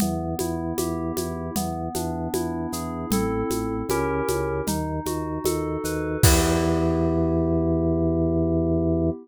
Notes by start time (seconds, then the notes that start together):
0.00 E2 B3, low conga, shaker
0.39 E2 E4, high conga, shaker
0.77 E2 G4, high conga, shaker
1.17 E2 E4, high conga, shaker
1.56 E2 B3, low conga, shaker
1.95 E2 D4, high conga, shaker
2.34 E2 E4, high conga, shaker
2.72 E2 G#4, shaker
3.10 A1 C4 E4 A4, low conga, shaker
3.50 A1, high conga, shaker
3.89 C#2 C#4 E4 G4 A#4, high conga, shaker
4.28 C#2, high conga, shaker
4.67 D#2 D#4, low conga, shaker
5.06 D#2 F#4, high conga, shaker
5.44 D#2 A4, high conga, shaker
5.84 D#2 B4, shaker
6.23 E2 B3 E4 G4, kick, crash